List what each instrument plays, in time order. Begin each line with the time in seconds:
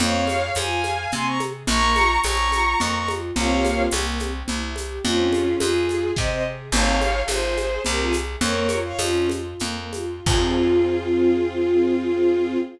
0.00 electric bass (finger) F2, string ensemble 1 C4, violin C#5 F5, low conga, shaker
0.27 string ensemble 1 G#4, high conga, shaker
0.55 electric bass (finger) F2, string ensemble 1 F4, violin F5 G#5, tambourine, high conga, shaker
0.84 string ensemble 1 G#4, high conga, shaker
1.12 electric bass (finger) C3, string ensemble 1 C4, violin G#5 C6, low conga, shaker
1.25 violin A#5 C#6
1.40 string ensemble 1 G#4, high conga, shaker
1.67 electric bass (finger) A#1, string ensemble 1 A#3, violin A#5 C#6, low conga, shaker
1.96 string ensemble 1 F4, high conga, shaker
2.24 electric bass (finger) A#1, string ensemble 1 C#4, violin A#5 C#6, tambourine, high conga, shaker
2.52 string ensemble 1 F4, high conga, shaker
2.80 electric bass (finger) F2, string ensemble 1 A#3, violin A#5 C#6, low conga, shaker
2.95 violin A#5 C#6
3.08 string ensemble 1 F4, high conga, shaker
3.36 electric bass (finger) C2, string ensemble 1 A#3 C4 F4 G4, violin C#5 F5, low conga, shaker
3.65 high conga, shaker
3.91 electric bass (finger) C2, string ensemble 1 A#3, tambourine, high conga, shaker
4.19 string ensemble 1 C4, high conga, shaker
4.48 electric bass (finger) C2, string ensemble 1 E4, low conga, shaker
4.76 string ensemble 1 G4, high conga, shaker
5.04 electric bass (finger) F2, string ensemble 1 C4, violin C#4 F4, low conga, shaker
5.32 string ensemble 1 G#4, high conga, shaker
5.60 electric bass (finger) F2, string ensemble 1 F4, violin F4 G#4, tambourine, high conga, shaker
5.89 string ensemble 1 G#4, high conga, shaker
6.16 electric bass (finger) C3, string ensemble 1 C4, violin C5 D#5, kick, snare
6.30 violin C5 D#5
6.45 string ensemble 1 G#4
6.72 electric bass (finger) G#1, string ensemble 1 C4, violin C#5 F5, crash, low conga, shaker
7.01 string ensemble 1 G#4, high conga, shaker
7.28 electric bass (finger) G#1, string ensemble 1 F4, violin G#4 C5, tambourine, high conga, shaker
7.57 string ensemble 1 G#4, high conga, shaker
7.85 electric bass (finger) C2, string ensemble 1 C4, violin G4 A#4, low conga, shaker
8.00 violin F4 G#4
8.13 string ensemble 1 G#4, high conga, shaker
8.41 electric bass (finger) F2, string ensemble 1 A#3, violin A#4 C#5, low conga, shaker
8.69 string ensemble 1 F4, high conga, shaker
8.85 violin C#5 F5
8.99 electric bass (finger) F2, string ensemble 1 C#4, violin C#4 F4, tambourine, high conga, shaker
9.29 string ensemble 1 F4, high conga, shaker
9.60 electric bass (finger) F2, string ensemble 1 A#3, low conga, shaker
9.93 string ensemble 1 F4, high conga, shaker
10.26 electric bass (finger) F2, string ensemble 1 C4 F4 G#4, violin F4, kick, crash